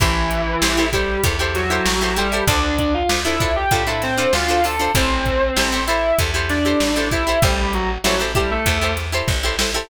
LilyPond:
<<
  \new Staff \with { instrumentName = "Distortion Guitar" } { \time 4/4 \key a \dorian \tempo 4 = 97 <e e'>4. <g g'>8 r8 <fis fis'>4 <g g'>8 | <d' d''>8 <d' d''>16 <f' f''>16 r16 <e' e''>8 <g' g''>16 <g' g''>16 <e' e''>16 <c' c''>8 <f' f''>8 <a' a''>8 | <c' c''>4. <e' e''>8 r8 <d' d''>4 <e' e''>8 | <g g'>8 <fis fis'>16 r16 <fis fis'>16 r16 <g g'>16 <a a'>8. r4. | }
  \new Staff \with { instrumentName = "Acoustic Guitar (steel)" } { \time 4/4 \key a \dorian <e' g' a' c''>4 <e' g' a' c''>16 <e' g' a' c''>16 <e' g' a' c''>8 <e' g' a' c''>16 <e' g' a' c''>8 <e' g' a' c''>8 <e' g' a' c''>16 <e' g' a' c''>16 <e' g' a' c''>16 | <d' f' a' c''>4 <d' f' a' c''>16 <d' f' a' c''>16 <d' f' a' c''>8 <d' f' a' c''>16 <d' f' a' c''>8 <d' f' a' c''>8 <d' f' a' c''>16 <d' f' a' c''>16 <d' f' a' c''>16 | <e' g' a' c''>4 <e' g' a' c''>16 <e' g' a' c''>16 <e' g' a' c''>8 <e' g' a' c''>16 <e' g' a' c''>8 <e' g' a' c''>8 <e' g' a' c''>16 <e' g' a' c''>16 <e' g' a' c''>16 | <e' g' a' c''>4 <e' g' a' c''>16 <e' g' a' c''>16 <e' g' a' c''>8 <e' g' a' c''>16 <e' g' a' c''>8 <e' g' a' c''>8 <e' g' a' c''>16 <e' g' a' c''>16 <e' g' a' c''>16 | }
  \new Staff \with { instrumentName = "Electric Bass (finger)" } { \clef bass \time 4/4 \key a \dorian a,,4 a,,4 e,4 a,,4 | d,4 d,4 a,4 d,4 | a,,4 a,,4 e,4 a,,4 | a,,4 a,,4 e,4 a,,4 | }
  \new DrumStaff \with { instrumentName = "Drums" } \drummode { \time 4/4 <hh bd>8 hh8 sn8 <hh bd>8 <hh bd>8 <hh sn>8 sn8 hh8 | <hh bd>8 <hh bd>8 sn8 <hh bd>8 <hh bd>8 <hh sn>8 sn8 hho8 | <hh bd>8 <hh bd>8 sn8 hh8 <hh bd>8 <hh sn>8 sn8 <hh bd>8 | <hh bd>8 hh8 sn8 <hh bd>8 <hh bd>8 <hh sn>8 <bd sn>8 sn8 | }
>>